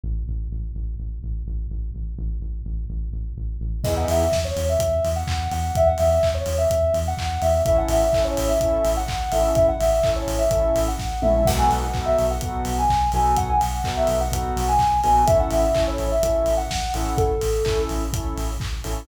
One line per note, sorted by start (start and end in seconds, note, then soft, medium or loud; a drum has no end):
0.03 0.24 A1 medium
0.28 0.48 A1 medium
0.51 0.72 A1 medium
0.75 0.95 A1 medium
0.99 1.19 A1 medium
1.23 1.43 A1 medium
1.47 1.67 A1 medium
1.70 1.91 A1 medium
1.94 2.14 A1 medium
2.18 2.39 A1 medium
2.42 2.62 A1 medium
2.65 2.86 A1 medium
2.90 3.10 A1 medium
3.13 3.33 A1 medium
3.37 3.58 A1 medium
3.61 3.81 A1 medium
3.84 4.05 E2 medium
3.84 4.23 B3 medium
3.84 4.23 D#4 medium
3.84 4.23 E4 medium
3.84 4.23 G#4 medium
3.84 3.95 D#5 medium
3.84 kick medium
3.84 crash medium
3.97 4.08 F#5 medium
4.08 4.29 E2 medium
4.08 4.37 E5 medium
4.08 open hi-hat medium
4.32 4.52 E2 medium
4.32 kick medium
4.32 snare medium
4.45 4.65 C#5 medium
4.56 4.77 E2 medium
4.56 open hi-hat medium
4.69 5.09 E5 medium
4.79 5.00 E2 medium
4.79 kick medium
4.79 closed hi-hat loud
5.04 5.24 E2 medium
5.04 open hi-hat medium
5.16 5.49 F#5 medium
5.27 5.48 E2 medium
5.27 kick medium
5.27 clap loud
5.51 5.71 E2 medium
5.51 5.75 F#5 medium
5.51 open hi-hat medium
5.75 5.96 E2 medium
5.75 5.88 E5 loud
5.75 kick medium
5.75 closed hi-hat medium
5.87 5.98 F#5 medium
5.98 6.20 E2 medium
5.98 6.28 E5 medium
5.98 open hi-hat medium
6.23 6.43 E2 medium
6.23 kick medium
6.23 clap medium
6.34 6.54 C#5 medium
6.46 6.66 E2 medium
6.46 open hi-hat medium
6.58 6.97 E5 medium
6.70 6.91 E2 medium
6.70 kick medium
6.70 closed hi-hat medium
6.94 7.14 E2 medium
6.94 open hi-hat medium
7.07 7.39 F#5 medium
7.17 7.38 E2 medium
7.17 kick medium
7.17 clap loud
7.42 7.62 E2 medium
7.42 7.62 E5 medium
7.42 open hi-hat medium
7.65 7.86 A1 medium
7.65 8.04 C#4 medium
7.65 8.04 E4 medium
7.65 8.04 A4 medium
7.65 7.77 E5 loud
7.65 kick medium
7.65 closed hi-hat medium
7.78 7.89 F#5 medium
7.88 8.09 A1 medium
7.88 8.22 E5 medium
7.88 open hi-hat medium
8.13 8.33 A1 medium
8.13 8.52 C#4 medium
8.13 8.52 E4 medium
8.13 8.52 A4 medium
8.13 kick medium
8.13 clap medium
8.24 8.45 C#5 medium
8.37 8.57 A1 medium
8.37 open hi-hat medium
8.48 8.90 E5 medium
8.61 8.81 A1 medium
8.61 8.99 C#4 medium
8.61 8.99 E4 medium
8.61 8.99 A4 medium
8.61 kick medium
8.61 closed hi-hat medium
8.85 9.05 A1 medium
8.85 open hi-hat medium
8.97 9.30 F#5 medium
9.08 9.29 A1 medium
9.08 kick medium
9.08 clap loud
9.32 9.53 A1 medium
9.32 9.71 C#4 medium
9.32 9.71 E4 medium
9.32 9.71 A4 medium
9.32 9.53 E5 medium
9.32 open hi-hat medium
9.55 9.76 A1 medium
9.55 9.66 E5 loud
9.55 kick medium
9.55 closed hi-hat medium
9.68 9.80 F#5 medium
9.79 10.00 A1 medium
9.79 10.11 E5 medium
9.79 open hi-hat medium
10.03 10.24 A1 medium
10.03 10.42 C#4 medium
10.03 10.42 E4 medium
10.03 10.42 A4 medium
10.03 kick medium
10.03 clap medium
10.16 10.38 C#5 medium
10.27 10.48 A1 medium
10.27 open hi-hat medium
10.38 10.80 E5 medium
10.51 10.72 A1 medium
10.51 10.89 C#4 medium
10.51 10.89 E4 medium
10.51 10.89 A4 medium
10.51 kick medium
10.51 closed hi-hat medium
10.76 10.96 A1 medium
10.76 open hi-hat medium
10.88 11.18 F#5 medium
10.99 11.21 A1 medium
10.99 kick medium
10.99 snare medium
11.22 11.44 A#1 medium
11.22 11.42 C#4 medium
11.22 11.42 E4 medium
11.22 11.42 A4 medium
11.22 11.46 E5 medium
11.22 mid tom loud
11.45 11.67 B1 medium
11.45 11.85 B3 medium
11.45 11.85 D#4 medium
11.45 11.85 F#4 medium
11.45 11.85 A4 medium
11.45 11.58 F#5 medium
11.45 kick loud
11.45 crash loud
11.58 11.69 G#5 medium
11.70 11.90 B1 medium
11.70 12.00 F#5 medium
11.70 open hi-hat medium
11.94 12.14 B1 medium
11.94 12.32 B3 medium
11.94 12.32 D#4 medium
11.94 12.32 F#4 medium
11.94 12.32 A4 medium
11.94 kick medium
11.94 clap medium
12.06 12.25 E5 medium
12.18 12.38 B1 medium
12.18 open hi-hat medium
12.30 12.70 F#5 medium
12.41 12.62 B1 medium
12.41 12.80 B3 medium
12.41 12.80 D#4 medium
12.41 12.80 F#4 medium
12.41 12.80 A4 medium
12.41 kick medium
12.41 closed hi-hat medium
12.65 12.86 B1 medium
12.65 open hi-hat medium
12.78 13.08 G#5 medium
12.89 13.10 B1 medium
12.89 kick medium
12.89 clap medium
13.12 13.34 B1 medium
13.12 13.52 B3 medium
13.12 13.52 D#4 medium
13.12 13.52 F#4 medium
13.12 13.52 A4 medium
13.12 13.35 G#5 medium
13.12 open hi-hat medium
13.36 13.58 B1 medium
13.36 13.48 F#5 loud
13.36 kick medium
13.36 closed hi-hat medium
13.49 13.60 G#5 medium
13.61 13.81 B1 medium
13.61 13.92 F#5 medium
13.61 open hi-hat medium
13.84 14.05 B1 medium
13.84 14.22 B3 medium
13.84 14.22 D#4 medium
13.84 14.22 F#4 medium
13.84 14.22 A4 medium
13.84 kick medium
13.84 clap loud
13.97 14.17 E5 medium
14.07 14.29 B1 medium
14.07 open hi-hat medium
14.21 14.61 F#5 medium
14.32 14.52 B1 medium
14.32 14.70 B3 medium
14.32 14.70 D#4 medium
14.32 14.70 F#4 medium
14.32 14.70 A4 medium
14.32 kick medium
14.32 closed hi-hat loud
14.57 14.77 B1 medium
14.57 open hi-hat medium
14.68 14.98 G#5 medium
14.79 15.01 B1 medium
14.79 kick medium
14.79 clap medium
15.03 15.25 A#1 medium
15.03 15.23 B3 medium
15.03 15.23 D#4 medium
15.03 15.23 F#4 medium
15.03 15.23 A4 medium
15.03 15.25 G#5 medium
15.03 open hi-hat medium
15.27 15.48 A1 medium
15.27 15.65 C#4 medium
15.27 15.65 E4 medium
15.27 15.65 A4 medium
15.27 15.38 E5 loud
15.27 kick loud
15.27 closed hi-hat loud
15.40 15.51 F#5 medium
15.50 15.71 A1 medium
15.50 15.82 E5 medium
15.50 open hi-hat medium
15.75 15.96 A1 medium
15.75 16.13 C#4 medium
15.75 16.13 E4 medium
15.75 16.13 A4 medium
15.75 kick medium
15.75 clap loud
15.87 16.07 C#5 medium
15.98 16.19 A1 medium
15.98 open hi-hat medium
16.12 16.55 E5 medium
16.23 16.43 A1 medium
16.23 16.61 C#4 medium
16.23 16.61 E4 medium
16.23 16.61 A4 medium
16.23 kick medium
16.23 closed hi-hat loud
16.46 16.67 A1 medium
16.46 open hi-hat medium
16.57 16.89 F#5 medium
16.70 16.91 A1 medium
16.70 kick medium
16.70 snare loud
16.94 17.14 A1 medium
16.94 17.33 C#4 medium
16.94 17.33 E4 medium
16.94 17.33 A4 medium
16.94 17.14 F#5 medium
16.94 open hi-hat medium
17.17 17.38 A1 medium
17.17 17.81 A4 medium
17.17 kick loud
17.17 closed hi-hat medium
17.41 17.62 A1 medium
17.41 open hi-hat medium
17.65 17.86 A1 medium
17.65 18.03 C#4 medium
17.65 18.03 E4 medium
17.65 18.03 A4 medium
17.65 kick medium
17.65 clap loud
17.89 18.10 A1 medium
17.89 open hi-hat medium
18.13 18.34 A1 medium
18.13 18.51 C#4 medium
18.13 18.51 E4 medium
18.13 18.51 A4 medium
18.13 kick medium
18.13 closed hi-hat loud
18.37 18.57 A1 medium
18.37 open hi-hat medium
18.60 18.81 A1 medium
18.60 kick medium
18.60 clap medium
18.84 19.05 A1 medium
18.84 19.03 C#4 medium
18.84 19.03 E4 medium
18.84 19.03 A4 medium
18.84 open hi-hat medium